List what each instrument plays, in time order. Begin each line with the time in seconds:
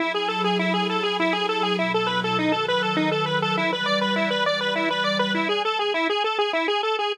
0.00 pad 5 (bowed) F#3 E4 G#4 A4, lead 1 (square) E4
0.14 lead 1 (square) G#4
0.28 lead 1 (square) A4
0.44 lead 1 (square) G#4
0.59 lead 1 (square) E4
0.74 lead 1 (square) G#4
0.89 lead 1 (square) A4
1.03 lead 1 (square) G#4
1.20 lead 1 (square) E4
1.33 lead 1 (square) G#4
1.49 lead 1 (square) A4
1.63 lead 1 (square) G#4
1.78 pad 5 (bowed) B2 F#3 E4 A4, lead 1 (square) E4
1.94 lead 1 (square) A4
2.07 lead 1 (square) B4
2.24 lead 1 (square) A4
2.38 pad 5 (bowed) D#3 F#3 A4 B4, lead 1 (square) D#4
2.52 lead 1 (square) A4
2.68 lead 1 (square) B4
2.82 lead 1 (square) A4
2.97 lead 1 (square) D#4
3.12 lead 1 (square) A4
3.26 lead 1 (square) B4
3.42 lead 1 (square) A4
3.56 pad 5 (bowed) E3 G3 B4 D5, lead 1 (square) E4
3.73 lead 1 (square) B4
3.86 lead 1 (square) D5
4.01 lead 1 (square) B4
4.16 lead 1 (square) E4
4.30 lead 1 (square) B4
4.46 lead 1 (square) D5
4.61 lead 1 (square) B4
4.75 lead 1 (square) E4
4.90 lead 1 (square) B4
5.04 lead 1 (square) D5
5.19 lead 1 (square) B4
5.35 lead 1 (square) E4
5.49 lead 1 (square) G#4
5.65 lead 1 (square) A4
5.79 lead 1 (square) G#4
5.94 lead 1 (square) E4
6.10 lead 1 (square) G#4
6.24 lead 1 (square) A4
6.38 lead 1 (square) G#4
6.53 lead 1 (square) E4
6.68 lead 1 (square) G#4
6.83 lead 1 (square) A4
6.99 lead 1 (square) G#4